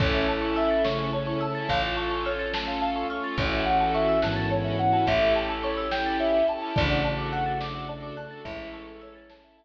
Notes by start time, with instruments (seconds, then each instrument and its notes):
0.00 electric bass (finger) A1, string ensemble 1 C#4 E4 A4, tubular bells C#4 A4, pad 2 (warm) C#4 E4 A4, marimba C#5, ocarina C#5, kick, crash
0.14 marimba E5
0.28 string ensemble 1 C#4 E4 A4, marimba A5, ocarina A5
0.42 marimba C#6
0.56 ocarina E5, marimba E6, closed hi-hat
0.71 marimba A6
0.84 tubular bells C#3 A3, pad 2 (warm) A3 C#4 A4, string ensemble 1 C#4 E4 A4, marimba C#5, ocarina C#6, snare
0.99 marimba E5
1.13 string ensemble 1 C#4 E4 A4, ocarina C#5, marimba A5
1.27 marimba C#6
1.41 string ensemble 1 C#4 E4, ocarina A5, marimba E6, closed hi-hat
1.45 string ensemble 1 A4
1.55 marimba A6
1.69 electric bass (finger) A1, pad 2 (warm) C#4 F4 A4, string ensemble 1 C#4 F4, marimba C#5, ocarina F5, kick, closed hi-hat
1.73 string ensemble 1 A4
1.83 marimba F5
1.96 marimba A5, ocarina C#6
2.11 marimba C#6
2.25 ocarina C#5, marimba F6, closed hi-hat
2.39 marimba A6
2.53 pad 2 (warm) A3 C#4 A4, string ensemble 1 C#4 F4 A4, marimba C#5, ocarina A5, snare
2.68 marimba F5
2.81 ocarina F5, marimba A5
2.96 marimba C#6
3.10 string ensemble 1 C#4 F4 A4, ocarina C#6, marimba F6, closed hi-hat
3.24 marimba A6
3.38 electric bass (finger) A1, tubular bells E3 C#4, string ensemble 1 C#4 E4 F#4, pad 2 (warm) C#4 E4 F#4 A4, marimba C#5, ocarina C#5, kick, closed hi-hat
3.43 string ensemble 1 A4
3.52 marimba E5
3.65 string ensemble 1 C#4 E4, ocarina F#5, marimba F#5
3.70 string ensemble 1 F#4 A4
3.80 marimba A5
3.94 ocarina E5, marimba C#6, closed hi-hat
4.08 marimba E6
4.22 tubular bells G#2 E3, string ensemble 1 C#4 E4 F#4, pad 2 (warm) C#4 E4 A4 C#5, ocarina A5, marimba F#6, snare
4.27 string ensemble 1 A4
4.36 marimba A6
4.51 string ensemble 1 C#4 E4 F#4, marimba C#5, ocarina C#5
4.56 string ensemble 1 A4
4.65 marimba E5
4.79 string ensemble 1 C#4 E4 F#4, marimba F#5, ocarina F#5, closed hi-hat
4.84 string ensemble 1 A4
4.93 marimba A5
5.07 electric bass (finger) A1, pad 2 (warm) C#4 E4 G4 A4, string ensemble 1 C#4 E4 G4, marimba C#5, ocarina E5, kick, closed hi-hat
5.12 string ensemble 1 A4
5.21 marimba E5
5.35 marimba G5, ocarina A5
5.49 marimba A5
5.63 ocarina C#5, marimba C#6, closed hi-hat
5.77 marimba E6
5.91 string ensemble 1 C#4 E4 G4, pad 2 (warm) C#4 E4 A4 C#5, ocarina G5, marimba G6, snare
5.97 string ensemble 1 A4
6.06 marimba A6
6.20 marimba C#5, ocarina E5
6.34 marimba E5
6.48 string ensemble 1 C#4 E4 G4, marimba G5, ocarina A5, closed hi-hat
6.53 string ensemble 1 A4
6.62 marimba A5
6.76 electric bass (finger) A1, tubular bells C#3 A3, string ensemble 1 D4 F#4 A4, pad 2 (warm) D4 F#4 A4, marimba D5, ocarina D5, kick, closed hi-hat
6.90 marimba F#5
7.04 string ensemble 1 D4 F#4 A4, ocarina A5, marimba A5
7.18 marimba D6
7.32 ocarina F#5, marimba F#6, closed hi-hat
7.46 marimba A6
7.60 string ensemble 1 D4 F#4 A4, pad 2 (warm) D4 A4 D5, marimba D5, ocarina D6, snare
7.75 marimba F#5
7.89 string ensemble 1 D4 F#4 A4, ocarina D5, marimba A5
8.03 marimba D6
8.17 string ensemble 1 D4 F#4 A4, ocarina A5, marimba F#6, closed hi-hat
8.31 marimba A6
8.44 electric bass (finger) A1, tubular bells G#3 E4, string ensemble 1 C#4 E4, pad 2 (warm) C#4 E4 A4, marimba C#5, ocarina E5, kick, closed hi-hat
8.49 string ensemble 1 A4
8.59 marimba E5
8.73 marimba A5, ocarina C#6
8.87 marimba C#6
9.01 ocarina C#5, marimba E6, closed hi-hat
9.15 marimba A6
9.30 pad 2 (warm) A3 C#4 A4, string ensemble 1 C#4 E4 A4, marimba C#5, ocarina A5, snare
9.44 marimba E5
9.57 ocarina E5, marimba A5